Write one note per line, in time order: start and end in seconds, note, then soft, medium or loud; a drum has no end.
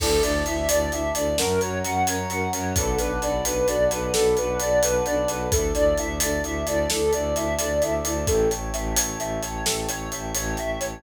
0.00 0.18 D2 medium
0.00 0.08 D4 medium
0.00 0.08 E4 medium
0.00 0.08 A4 medium
0.00 0.21 A4 medium
0.00 1.36 D5 medium
0.00 1.36 E5 medium
0.00 1.36 A5 medium
0.00 kick medium
0.00 crash loud
0.22 0.42 D2 medium
0.22 0.32 D4 medium
0.22 0.32 E4 medium
0.22 0.32 A4 medium
0.22 0.44 D5 medium
0.22 closed hi-hat medium
0.46 0.66 D2 medium
0.46 0.55 D4 medium
0.46 0.55 E4 medium
0.46 0.55 A4 medium
0.46 0.67 E5 medium
0.46 closed hi-hat medium
0.69 0.89 D2 medium
0.69 0.80 D4 medium
0.69 0.80 E4 medium
0.69 0.80 A4 medium
0.69 0.90 D5 medium
0.69 closed hi-hat loud
0.90 1.10 D2 medium
0.90 1.02 D4 medium
0.90 1.02 E4 medium
0.90 1.02 A4 medium
0.90 1.13 E5 medium
0.90 closed hi-hat medium
1.15 1.34 D2 medium
1.15 1.24 D4 medium
1.15 1.24 E4 medium
1.15 1.24 A4 medium
1.15 1.36 D5 medium
1.15 closed hi-hat medium
1.37 1.58 F#2 medium
1.37 1.46 C#4 loud
1.37 1.46 F#4 medium
1.37 1.46 A#4 loud
1.37 1.59 A#4 medium
1.37 2.74 C#5 medium
1.37 2.74 F#5 medium
1.37 2.74 A#5 medium
1.37 snare loud
1.61 1.82 F#2 medium
1.61 1.70 C#4 medium
1.61 1.70 F#4 medium
1.61 1.70 A#4 medium
1.61 1.82 C#5 medium
1.61 closed hi-hat medium
1.83 2.03 F#2 medium
1.83 1.92 C#4 medium
1.83 1.92 F#4 medium
1.83 1.92 A#4 medium
1.83 2.05 F#5 medium
1.83 closed hi-hat medium
2.06 2.26 F#2 medium
2.06 2.16 C#4 medium
2.06 2.16 F#4 medium
2.06 2.16 A#4 medium
2.06 2.29 C#5 medium
2.06 closed hi-hat medium
2.29 2.48 F#2 medium
2.29 2.40 C#4 medium
2.29 2.40 F#4 loud
2.29 2.40 A#4 medium
2.29 2.51 F#5 medium
2.29 closed hi-hat medium
2.51 2.73 F#2 medium
2.51 2.60 C#4 medium
2.51 2.60 F#4 medium
2.51 2.60 A#4 medium
2.51 2.74 C#5 medium
2.51 closed hi-hat medium
2.76 2.95 B1 medium
2.76 2.86 D4 medium
2.76 2.86 F#4 medium
2.76 2.97 A4 medium
2.76 2.86 A4 medium
2.76 2.86 B4 medium
2.76 5.49 D5 medium
2.76 5.49 F#5 medium
2.76 5.49 A5 medium
2.76 5.49 B5 medium
2.76 kick medium
2.76 closed hi-hat medium
2.98 3.18 B1 medium
2.98 3.08 D4 medium
2.98 3.08 F#4 medium
2.98 3.08 A4 medium
2.98 3.20 B4 medium
2.98 3.08 B4 medium
2.98 closed hi-hat medium
3.22 3.41 B1 medium
3.22 3.32 D4 medium
3.22 3.32 F#4 medium
3.22 3.32 A4 medium
3.22 3.32 B4 medium
3.22 3.44 D5 medium
3.22 closed hi-hat medium
3.44 3.64 B1 medium
3.44 3.54 D4 medium
3.44 3.54 F#4 medium
3.44 3.54 A4 medium
3.44 3.54 B4 medium
3.44 3.66 B4 medium
3.44 closed hi-hat medium
3.66 3.88 B1 medium
3.66 3.76 D4 medium
3.66 3.76 F#4 medium
3.66 3.76 A4 medium
3.66 3.76 B4 medium
3.66 3.89 D5 medium
3.66 closed hi-hat medium
3.90 4.10 B1 medium
3.90 3.99 D4 medium
3.90 3.99 F#4 medium
3.90 3.99 A4 medium
3.90 3.99 B4 medium
3.90 4.12 B4 medium
3.90 closed hi-hat medium
4.13 4.34 B1 medium
4.13 4.22 D4 medium
4.13 4.22 F#4 medium
4.13 4.22 A4 medium
4.13 4.34 A4 medium
4.13 4.22 B4 medium
4.13 snare loud
4.37 4.57 B1 medium
4.37 4.47 D4 medium
4.37 4.47 F#4 medium
4.37 4.47 A4 medium
4.37 4.58 B4 medium
4.37 4.47 B4 medium
4.37 closed hi-hat medium
4.60 4.80 B1 medium
4.60 4.70 D4 medium
4.60 4.70 F#4 medium
4.60 4.70 A4 medium
4.60 4.70 B4 medium
4.60 4.81 D5 medium
4.60 closed hi-hat medium
4.81 5.00 B1 medium
4.81 4.91 D4 medium
4.81 4.91 F#4 medium
4.81 4.91 A4 medium
4.81 4.91 B4 medium
4.81 5.04 B4 medium
4.81 closed hi-hat medium
5.06 5.25 B1 medium
5.06 5.16 D4 medium
5.06 5.16 F#4 medium
5.06 5.16 A4 medium
5.06 5.16 B4 medium
5.06 5.27 D5 medium
5.06 closed hi-hat medium
5.28 5.47 B1 medium
5.28 5.38 D4 medium
5.28 5.38 F#4 medium
5.28 5.38 A4 medium
5.28 5.38 B4 medium
5.28 5.50 B4 medium
5.28 closed hi-hat medium
5.51 5.71 D2 medium
5.51 5.61 D4 loud
5.51 5.61 E4 loud
5.51 5.72 A4 medium
5.51 5.61 A4 medium
5.51 8.26 D5 medium
5.51 8.26 E5 medium
5.51 8.26 A5 medium
5.51 kick loud
5.51 closed hi-hat medium
5.74 5.94 D2 medium
5.74 5.84 D4 medium
5.74 5.84 E4 medium
5.74 5.84 A4 medium
5.74 5.96 D5 medium
5.74 closed hi-hat medium
5.97 6.19 D2 medium
5.97 6.07 D4 medium
5.97 6.07 E4 medium
5.97 6.07 A4 medium
5.97 6.19 E5 medium
5.97 closed hi-hat medium
6.20 6.40 D2 medium
6.20 6.30 D4 medium
6.20 6.30 E4 medium
6.20 6.30 A4 medium
6.20 6.42 D5 medium
6.20 closed hi-hat loud
6.43 6.62 D2 medium
6.43 6.53 D4 medium
6.43 6.53 E4 medium
6.43 6.53 A4 medium
6.43 6.65 E5 medium
6.43 closed hi-hat medium
6.66 6.85 D2 medium
6.66 6.76 D4 medium
6.66 6.76 E4 medium
6.66 6.76 A4 medium
6.66 6.88 D5 medium
6.66 closed hi-hat medium
6.90 7.10 D2 medium
6.90 7.01 D4 medium
6.90 7.01 E4 medium
6.90 7.11 A4 medium
6.90 7.01 A4 medium
6.90 snare loud
7.13 7.33 D2 medium
7.13 7.23 D4 medium
7.13 7.23 E4 medium
7.13 7.23 A4 medium
7.13 7.34 D5 medium
7.13 closed hi-hat medium
7.35 7.54 D2 medium
7.35 7.45 D4 medium
7.35 7.45 E4 medium
7.35 7.45 A4 medium
7.35 7.57 E5 medium
7.35 closed hi-hat medium
7.58 7.79 D2 medium
7.58 7.68 D4 medium
7.58 7.68 E4 medium
7.58 7.68 A4 medium
7.58 7.80 D5 medium
7.58 closed hi-hat medium
7.81 8.00 D2 medium
7.81 7.91 D4 medium
7.81 7.91 E4 medium
7.81 7.91 A4 medium
7.81 8.03 E5 medium
7.81 closed hi-hat medium
8.04 8.24 D2 medium
8.04 8.14 D4 medium
8.04 8.14 E4 medium
8.04 8.14 A4 medium
8.04 8.26 D5 medium
8.04 closed hi-hat medium
8.27 8.47 A1 medium
8.27 8.48 A4 medium
8.27 11.02 C#5 medium
8.27 11.02 E5 medium
8.27 11.02 G5 medium
8.27 11.02 A5 medium
8.27 kick loud
8.27 closed hi-hat medium
8.51 8.70 A1 medium
8.51 8.72 C#5 medium
8.51 closed hi-hat medium
8.73 8.93 A1 medium
8.73 8.95 E5 medium
8.73 closed hi-hat medium
8.96 9.16 A1 medium
8.96 9.17 C#5 medium
8.96 closed hi-hat loud
9.19 9.39 A1 medium
9.19 9.41 E5 medium
9.19 closed hi-hat medium
9.42 9.62 A1 medium
9.42 9.64 C#5 medium
9.42 closed hi-hat medium
9.65 9.86 A1 medium
9.65 9.86 A4 medium
9.65 snare loud
9.88 10.08 A1 medium
9.88 10.09 C#5 medium
9.88 closed hi-hat medium
10.11 10.32 A1 medium
10.11 10.33 E5 medium
10.11 closed hi-hat medium
10.35 10.55 A1 medium
10.35 10.56 C#5 medium
10.35 closed hi-hat medium
10.57 10.77 A1 medium
10.57 10.79 E5 medium
10.57 closed hi-hat medium
10.80 11.00 A1 medium
10.80 11.01 C#5 medium
10.80 closed hi-hat medium